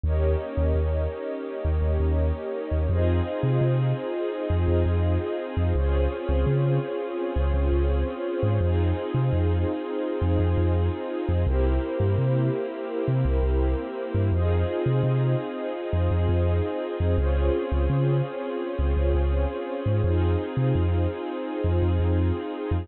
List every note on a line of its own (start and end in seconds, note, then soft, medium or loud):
0.03 0.36 D#2 medium
0.03 2.88 A#3 medium
0.03 2.88 C#4 medium
0.03 2.88 D#4 medium
0.03 2.87 G4 medium
0.03 2.88 G4 medium
0.03 2.87 A#4 medium
0.03 2.87 C#5 medium
0.03 2.87 D#5 medium
0.57 0.73 D#2 medium
0.75 1.07 D#2 medium
1.65 1.81 D#2 medium
1.82 1.98 D#2 medium
2.00 2.32 D#2 medium
2.71 2.88 D#2 medium
2.89 3.21 F2 loud
2.89 5.73 C4 medium
2.89 5.73 D#4 loud
2.89 5.73 F4 medium
2.89 5.73 F4 loud
2.89 5.73 G#4 loud
2.89 5.73 G#4 medium
2.89 5.73 C5 loud
2.89 5.73 D#5 medium
3.43 3.59 C3 medium
3.61 3.93 C3 medium
4.50 4.66 F2 medium
4.68 4.84 F2 medium
4.86 5.18 F2 medium
5.57 5.73 F2 medium
5.75 6.07 C#2 medium
5.75 8.59 C4 medium
5.75 8.59 C#4 medium
5.75 8.58 F4 loud
5.75 8.59 F4 loud
5.75 8.58 G#4 medium
5.75 8.59 G#4 loud
5.75 8.58 C5 loud
5.75 8.58 C#5 medium
6.29 6.45 C#2 medium
6.47 6.79 C#3 medium
7.36 7.52 C#2 medium
7.54 7.70 C#2 medium
7.72 8.04 C#2 medium
8.43 8.59 G#2 medium
8.60 8.93 F2 medium
8.60 11.44 C4 loud
8.60 11.43 D#4 loud
8.60 11.44 D#4 loud
8.60 11.43 F4 loud
8.60 11.44 F4 medium
8.60 11.43 G#4 loud
8.60 11.44 G#4 loud
8.60 11.43 C5 medium
9.14 9.30 C3 medium
9.33 9.65 F2 medium
10.21 10.38 F2 medium
10.39 10.55 F2 medium
10.57 10.90 F2 medium
11.29 11.45 F2 medium
11.46 11.79 C2 loud
11.46 14.30 A#3 loud
11.46 14.30 C4 medium
11.46 14.29 E4 medium
11.46 14.30 E4 medium
11.46 14.29 G4 loud
11.46 14.30 G4 medium
11.46 14.29 A#4 medium
11.46 14.29 C5 medium
12.00 12.16 G2 medium
12.18 12.50 C3 medium
13.08 13.24 C3 medium
13.25 13.41 C2 medium
13.43 13.75 C2 medium
14.14 14.31 G2 medium
14.32 14.64 F2 loud
14.32 17.16 C4 medium
14.32 17.16 D#4 loud
14.32 17.16 F4 loud
14.32 17.16 F4 medium
14.32 17.16 G#4 medium
14.32 17.16 G#4 loud
14.32 17.16 C5 loud
14.32 17.16 D#5 medium
14.86 15.02 C3 medium
15.03 15.35 C3 medium
15.93 16.09 F2 medium
16.11 16.27 F2 medium
16.29 16.61 F2 medium
17.00 17.16 F2 medium
17.18 17.50 C#2 medium
17.18 20.01 C4 medium
17.18 20.01 C#4 medium
17.18 20.00 F4 loud
17.18 20.01 F4 loud
17.18 20.00 G#4 medium
17.18 20.01 G#4 loud
17.18 20.00 C5 loud
17.18 20.00 C#5 medium
17.72 17.88 C#2 medium
17.89 18.22 C#3 medium
18.79 18.95 C#2 medium
18.97 19.13 C#2 medium
19.14 19.46 C#2 medium
19.86 20.02 G#2 medium
20.04 20.36 F2 medium
20.04 22.88 C4 loud
20.04 22.87 D#4 loud
20.04 22.88 D#4 loud
20.04 22.87 F4 loud
20.04 22.88 F4 medium
20.04 22.87 G#4 loud
20.04 22.88 G#4 loud
20.04 22.87 C5 medium
20.57 20.73 C3 medium
20.75 21.07 F2 medium
21.64 21.80 F2 medium
21.82 21.98 F2 medium
21.99 22.32 F2 medium
22.71 22.87 F2 medium